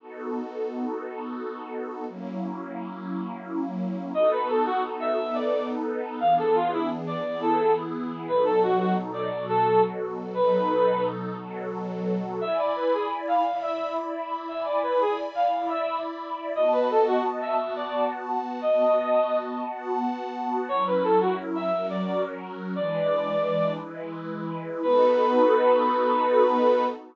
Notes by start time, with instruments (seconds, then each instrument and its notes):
0.00 pad 5 (bowed) B3 D#4 F#4 A4
2.07 pad 5 (bowed) F#3 A#3 C#4 E4
4.13 pad 5 (bowed) B3 D#4 F#4 A4, brass section D#5
4.31 brass section B4
4.49 brass section A4
4.66 brass section F#4
5.00 brass section E5
5.17 pad 5 (bowed) B3 D#4 A4 B4
5.34 brass section D5
6.20 pad 5 (bowed) E3 B3 D4 G#4, brass section F5
6.38 brass section A4
6.55 brass section F4
6.72 brass section E4
7.07 brass section D5
7.25 pad 5 (bowed) E3 B3 E4 G#4
7.41 brass section A4
8.28 pad 5 (bowed) B2 F#3 D#4 A4, brass section B4
8.45 brass section A4
8.63 brass section F#4
8.79 brass section F#4
9.14 brass section D5
9.31 pad 5 (bowed) B2 F#3 F#4 A4
9.48 brass section A4
10.34 pad 5 (bowed) B2 F#3 D#4 A4, brass section B4
11.37 pad 5 (bowed) B2 F#3 F#4 A4
12.41 pad 5 (bowed) E4 D5 G#5 B5, brass section E5
12.58 brass section D5
12.76 brass section B4
12.93 brass section G#4
13.27 brass section F5
13.45 pad 5 (bowed) E4 D5 E5 B5
13.62 brass section E5
14.48 pad 5 (bowed) E4 D5 G#5 B5, brass section E5
14.65 brass section D5
14.83 brass section B4
15.00 brass section G#4
15.35 brass section F5
15.52 pad 5 (bowed) E4 D5 E5 B5
15.69 brass section E5
16.55 pad 5 (bowed) B3 F#4 D#5 A5, brass section D#5
16.72 brass section B4
16.90 brass section A4
17.07 brass section F#4
17.41 brass section E5
17.59 pad 5 (bowed) B3 F#4 F#5 A5
17.76 brass section D5
18.62 pad 5 (bowed) B3 F#4 D#5 A5, brass section D#5
19.66 pad 5 (bowed) B3 F#4 F#5 A5
20.69 pad 5 (bowed) F#3 C#4 E4 A#4, brass section C#5
20.87 brass section B4
21.04 brass section A4
21.21 brass section F#4
21.55 brass section E5
21.72 pad 5 (bowed) F#3 C#4 F#4 A#4
21.90 brass section D5
22.76 pad 5 (bowed) E3 G#3 D4 B4, brass section D5
23.79 pad 5 (bowed) E3 G#3 E4 B4
24.83 pad 5 (bowed) B3 D#4 F#4 A4, brass section B4